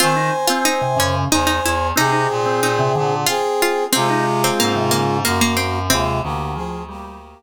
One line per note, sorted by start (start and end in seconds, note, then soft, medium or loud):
0.00 0.30 D#3 loud
0.00 0.16 C4 loud
0.00 0.47 F4 medium
0.00 1.15 C5 medium
0.00 1.15 G#5 loud
0.16 0.32 D#4 loud
0.47 0.65 C4 loud
0.47 0.63 F4 medium
0.65 0.82 C4 loud
0.65 0.97 D#4 medium
0.81 0.97 C3 loud
0.97 1.24 F#2 medium
0.97 1.28 C#3 loud
0.97 1.27 C#4 medium
1.31 1.59 E2 medium
1.31 1.46 D#4 medium
1.31 1.88 C5 medium
1.31 1.88 G#5 medium
1.47 1.62 D#4 medium
1.63 1.92 E2 medium
1.63 1.97 E4 medium
1.96 2.27 C3 loud
1.96 2.11 C4 loud
1.96 3.14 C4 medium
1.96 2.61 D#4 medium
1.96 3.14 G#4 medium
2.12 2.28 D#4 loud
2.30 2.60 A#2 medium
2.46 2.61 C4 loud
2.61 2.92 A#2 loud
2.61 2.79 C4 loud
2.61 3.21 D#4 medium
2.79 2.95 C3 loud
2.95 3.25 A#2 medium
2.95 3.26 D3 loud
3.26 3.84 C4 medium
3.26 3.53 F4 medium
3.26 3.84 G#4 medium
3.62 3.89 F4 medium
3.92 4.50 C3 loud
3.92 5.17 G#3 medium
3.92 4.08 C4 loud
3.92 4.38 C4 medium
3.92 5.17 F4 loud
4.10 4.25 D#4 loud
4.44 4.60 C4 medium
4.44 4.59 C4 loud
4.60 5.23 G#2 medium
4.60 4.90 A#3 medium
4.60 4.75 C4 loud
4.75 4.91 C3 loud
4.91 5.21 C#3 loud
4.91 5.18 A#3 medium
5.25 5.89 F#2 medium
5.25 5.40 A#3 medium
5.25 5.79 A#3 medium
5.25 5.79 F#4 medium
5.41 5.57 A#3 medium
5.57 5.88 C4 medium
5.90 6.21 D#2 medium
5.90 6.21 C3 loud
5.90 6.20 G#3 medium
5.90 7.42 C4 medium
5.90 6.20 F4 medium
6.22 7.34 D2 medium
6.22 6.56 D3 loud
6.22 6.54 A#3 medium
6.22 6.54 G4 medium
6.55 6.83 F3 loud
6.55 6.83 C4 medium
6.55 6.83 G#4 medium
6.89 7.18 G3 loud
6.89 7.42 A#3 medium
6.89 7.42 G4 medium